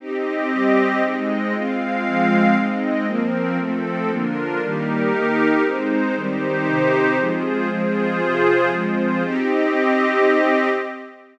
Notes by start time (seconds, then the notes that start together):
0.00 C4 D#4 G4 D#5
0.51 G3 C4 G4
1.03 G#3 C4 D#4 D#5
1.53 G#3 C4 F4 F5
2.05 F3 G#3 F4
2.56 G#3 C4 D#4 D#5
3.06 F3 A#3 C4 A#4
3.59 F3 A3 C4 A4
4.10 D3 F3 A#3 D4 F4 A#4
4.61 D#3 G3 A#3 D#4 G4 A#4
5.12 D#3 A#3 D#4
5.64 G#3 C4 D#4 C5
6.15 D#3 G3 C4 D#4 G4 C5
6.67 C3 D#3 C4
7.18 F3 G#3 C4 F4 G#4 C5
7.69 F3 G#3 C4 F4 G#4 C5
8.21 C3 F3 C4
8.72 F3 G#3 C4 F4 G#4 C5
9.24 C4 D#4 G4 D#5